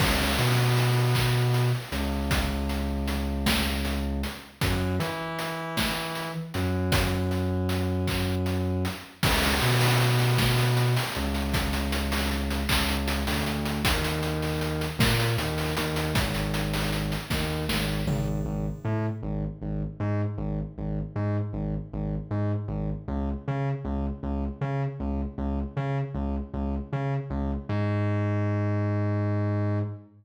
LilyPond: <<
  \new Staff \with { instrumentName = "Synth Bass 2" } { \clef bass \time 6/8 \key des \major \tempo 4. = 52 des,8 b,2 des,8~ | des,2. | ges,8 e2 ges,8~ | ges,2. |
des,8 b,2 des,8~ | des,4. des,8. d,8. | ees,4. bes,8 ees,8 ees,8 | aes,,4. ees,8 aes,,8 aes,,8 |
\key aes \major aes,,8 a,8 aes,,8 aes,,8 aes,8 aes,,8 | aes,,8 aes,8 aes,,8 aes,,8 aes,8 aes,,8 | des,8 des8 des,8 des,8 des8 des,8 | des,8 des8 des,8 des,8 des8 des,8 |
aes,2. | }
  \new DrumStaff \with { instrumentName = "Drums" } \drummode { \time 6/8 <cymc bd>8 hh8 hh8 <hc hh bd>8 hh8 hh8 | <hh bd>8 hh8 hh8 <bd sn>8 hh8 hh8 | <hh bd>8 hh8 hh8 <bd sn>8 hh8 hh8 | <hh bd>8 hh8 hh8 <hc bd>8 hh8 hh8 |
<cymc bd>16 hh16 hh16 hho16 hh16 hh16 <bd sn>16 hh16 hh16 hho16 hh16 hh16 | <hh bd>16 hh16 hh16 hho16 hh16 hh16 <hc bd>16 hh16 hh16 hho16 hh16 hh16 | <hh bd>16 hh16 hh16 hho16 hh16 hh16 <bd sn>16 hh16 hh16 hho16 hh16 hh16 | <hh bd>16 hh16 hh16 hho16 hh16 hh16 <bd sn>8 sn8 tomfh8 |
r4. r4. | r4. r4. | r4. r4. | r4. r4. |
r4. r4. | }
>>